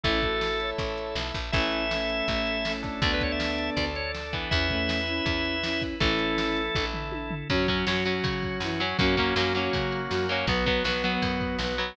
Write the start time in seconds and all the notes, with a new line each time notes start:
0.03 A1 E3 A3 C#4 E4 A4 E5 A5, kick, closed hi-hat
0.22 F#4 A4, kick, closed hi-hat
0.41 snare
0.60 A4 C#5, closed hi-hat
0.78 A1, kick, closed hi-hat
0.98 closed hi-hat
1.15 B1, snare
1.34 A#1, kick, snare, open hi-hat
1.52 A1 E3 A3 C#4 E4 A4 E5, kick, closed hi-hat
1.72 closed hi-hat
1.91 A3 C#4, snare
2.10 closed hi-hat
2.28 A1, kick, closed hi-hat
2.47 closed hi-hat
2.65 A3 C#4, snare
2.83 D4 A4, kick, snare, closed hi-hat
3.01 D2 D3 A3 B3 D4 A4 D5, kick, closed hi-hat
3.14 B4
3.21 C#5, kick, closed hi-hat
3.32 E5
3.40 snare
3.58 closed hi-hat
3.76 D2 D5, kick, closed hi-hat
3.95 C#5, closed hi-hat
4.15 snare
4.33 E3 B3, kick, snare, closed hi-hat
4.51 E2 C#4 E4 B4 E5, kick, closed hi-hat
4.69 A3 C#4, kick, closed hi-hat
4.89 snare
5.07 C#4 E4, closed hi-hat
5.26 E2, kick, closed hi-hat
5.45 closed hi-hat
5.63 C#4 E4, snare
5.82 kick, snare, closed hi-hat
6.00 A1 E3 A3 C#4 E4 A4, kick, closed hi-hat
6.19 closed hi-hat
6.38 snare
6.57 closed hi-hat
6.75 A1, kick, high tom
6.94 floor tom
7.12 high tom
7.31 floor tom
7.50 F#2 F#3 C#4 F#4, kick, crash
7.68 F#3 C#4, kick, snare, ride
7.87 F#2 F#3 C#4 F#4, snare
8.05 F#3 C#4, ride
8.16 F#3 F#4
8.24 C#3, kick, ride
8.43 kick, ride
8.60 F#2 E3 E4, snare
8.80 F#3 C#4, ride
8.98 F#2 F#3 A#3 C#4 F#4, kick, ride
9.17 F#3 A#3 C#4, kick, snare, ride
9.35 F#2 F#3 A#3 C#4 F#4, snare
9.55 F#3 A#3 C#4, ride
9.62 F#3 F#4
9.73 C#3 F#3 A#3 F#4, kick, ride
9.92 ride
10.10 F#2 F#3 F#4, snare
10.29 F#3 A#3 C#4, ride
10.47 B1 F#3 B3 F#4 B4, kick, ride
10.66 F#3 B3, kick, snare, ride
10.84 B1 F#3 B3 B4, snare
11.04 F#3 B3, ride
11.12 B3 B4
11.22 F#2, kick, ride
11.41 kick, ride
11.59 B1 B3 B4, snare
11.78 F#3 B3, ride